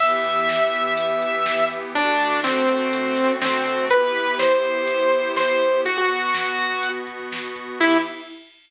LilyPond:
<<
  \new Staff \with { instrumentName = "Lead 2 (sawtooth)" } { \time 4/4 \key e \minor \tempo 4 = 123 e''1 | d'4 c'2 c'4 | b'4 c''2 c''4 | fis'16 fis'2~ fis'16 r4. |
e'4 r2. | }
  \new Staff \with { instrumentName = "Pad 5 (bowed)" } { \time 4/4 \key e \minor <e b g'>1 | <d a fis'>1 | <b e' g'>1 | <b, b fis'>1 |
<e b g'>4 r2. | }
  \new DrumStaff \with { instrumentName = "Drums" } \drummode { \time 4/4 <cymc bd>16 bd16 <hh bd>16 bd16 <bd sn>16 bd16 <hh bd>16 bd16 <hh bd>16 bd16 <hh bd>16 bd16 <bd sn>16 bd16 <hh bd>16 bd16 | <hh bd>16 bd16 <hh bd>16 bd16 <bd sn>16 bd16 <hh bd>16 bd16 <hh bd>16 bd16 <hh bd>16 bd16 <bd sn>16 bd16 <hh bd>16 bd16 | <hh bd>16 bd16 <hh bd>16 bd16 <bd sn>16 bd16 <hh bd>16 bd16 <hh bd>16 bd16 <hh bd>16 bd16 <bd sn>16 bd16 <hh bd>16 bd16 | <hh bd>16 bd16 <hh bd>16 bd16 <bd sn>16 bd16 <hh bd>16 bd16 <hh bd>16 bd16 <hh bd>16 bd16 <bd sn>16 bd16 <hh bd>16 bd16 |
<cymc bd>4 r4 r4 r4 | }
>>